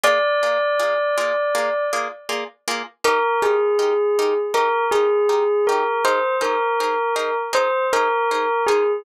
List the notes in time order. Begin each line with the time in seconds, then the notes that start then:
0.04 A#3 F4 G#4 D5
0.43 A#3 F4 G#4 D5
0.80 A#3 F4 G#4 D5
1.18 A#3 F4 G#4 D5
1.55 A#3 F4 G#4 D5
1.93 A#3 F4 G#4 D5
2.29 A#3 F4 G#4 D5
2.68 A#3 F4 G#4 D5
3.04 D#4 G4 A#4
3.42 D#4 G4 G#4 A#4
3.79 D#4 G4 A#4
4.19 D#4 G4 A#4
4.54 D#4 G4 A#4
4.91 D#4 G4 G#4 A#4
5.29 D#4 G4 A#4
5.67 D#4 G4 A#4
6.05 D#4 G#4 A#4 C5
6.41 D#4 G#4 A#4 C5
6.80 D#4 G#4 A#4 C5
7.16 D#4 G#4 A#4 C5
7.53 D#4 G#4 A#4 C5
7.93 D#4 G#4 A#4 C5
8.31 D#4 G#4 A#4 C5
8.67 D#4 G#4 A#4 C5